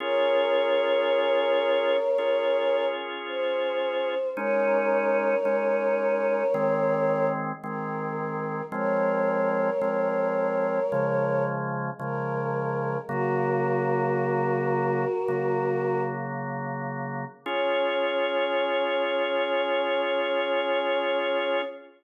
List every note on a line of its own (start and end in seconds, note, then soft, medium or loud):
0.00 1.97 C#4 medium
0.00 1.97 F4 medium
0.00 1.97 G#4 loud
0.00 2.85 A#4 loud
0.00 2.85 C#5 loud
2.18 4.15 C#4 medium
2.18 4.15 F4 medium
2.18 4.15 G#4 medium
3.27 4.30 C5 loud
4.37 5.35 G#3 medium
4.37 5.35 C#4 loud
4.37 5.35 D#4 loud
4.37 7.27 A#4 loud
4.37 7.27 C#5 loud
5.45 6.43 G#3 medium
5.45 6.43 C#4 medium
5.45 6.43 D#4 medium
6.54 7.52 D#3 medium
6.54 7.52 G#3 medium
6.54 7.52 C4 medium
7.64 8.62 D#3 medium
7.64 8.62 G#3 medium
7.64 8.62 C4 medium
7.64 8.64 A#4 medium
8.72 9.70 F3 medium
8.72 9.70 G#3 loud
8.72 9.70 C4 medium
8.72 11.44 A#4 loud
8.72 11.44 C#5 loud
9.81 10.80 F3 medium
9.81 10.80 G#3 medium
9.81 10.80 C4 medium
10.92 11.90 C#3 medium
10.92 11.90 F3 medium
10.92 11.90 G#3 medium
12.00 12.98 C#3 medium
12.00 12.98 F3 medium
12.00 12.98 G#3 medium
12.00 12.97 A#4 loud
13.08 15.05 C#3 medium
13.08 15.05 F#3 medium
13.08 15.05 A#3 medium
13.08 16.02 F#4 loud
13.08 16.02 A#4 loud
15.28 17.25 C#3 medium
15.28 17.25 F#3 medium
15.28 17.25 A#3 medium
17.46 21.62 C#4 loud
17.46 21.62 F4 medium
17.46 21.62 G#4 medium
17.46 21.62 C#5 loud